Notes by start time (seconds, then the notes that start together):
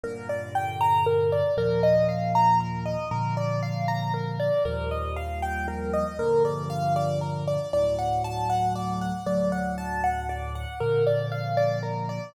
0.04 G2 A#2 D3 A#4
0.29 D5
0.55 G5
0.81 A#5
1.06 A#4
1.32 D5
1.57 D#2 A#2 F3 A#4
1.83 D#5
2.09 F5
2.35 A#5
2.60 A#4
2.86 D#5
3.11 A#2 D3 F3 A#4
3.37 D5
3.63 F5
3.88 A#5
4.14 A#4
4.40 D5
4.65 D#2 A#2 F3 G3 A#4
4.91 D#5
5.16 F5
5.42 G5
5.68 A#4
5.93 D#5
6.19 G2 A#2 D3 F3 A#4
6.45 D5
6.70 F5
6.96 D5
7.21 A#4
7.48 D5
7.73 D2 A2 F#3 D5
7.99 F#5
8.24 A5
8.50 F#5
8.76 D5
9.01 F#5
9.26 D2 A2 F#3 D5
9.52 F#5
9.78 A5
10.04 F#5
10.29 D5
10.55 F#5
10.80 A#2 D3 F3 A#4
11.07 D5
11.32 F5
11.57 D5
11.83 A#4
12.09 D5